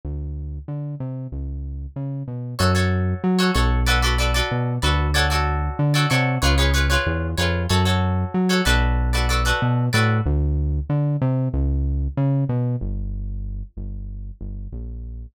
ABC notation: X:1
M:4/4
L:1/16
Q:1/4=94
K:F#m
V:1 name="Acoustic Guitar (steel)"
z16 | [FAc] [FAc]4 [FAc] [FAc]2 [FABd] [FABd] [FABd] [FABd]3 [FABd]2 | [FAcd] [FAcd]4 [FAcd] [FAcd]2 [^EGBc] [EGBc] [EGBc] [EGBc]3 [EGBc]2 | [FAc] [FAc]4 [FAc] [FABd]3 [FABd] [FABd] [FABd]3 [FABd]2 |
z16 | [K:Gm] z16 |]
V:2 name="Synth Bass 1" clef=bass
D,,4 D,2 =C,2 ^C,,4 ^C,2 B,,2 | F,,4 F,2 B,,,6 B,,2 D,,2- | D,,4 D,2 =C,2 ^C,,4 E,,2 ^E,,2 | F,,4 F,2 B,,,6 B,,2 A,,2 |
D,,4 D,2 =C,2 ^C,,4 ^C,2 B,,2 | [K:Gm] G,,,6 G,,,4 G,,,2 B,,,4 |]